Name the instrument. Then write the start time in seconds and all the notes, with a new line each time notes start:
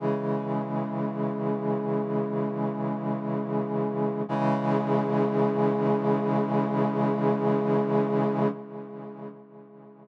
brass section
0.00 C#3 E3 G#3
4.29 C#3 E3 G#3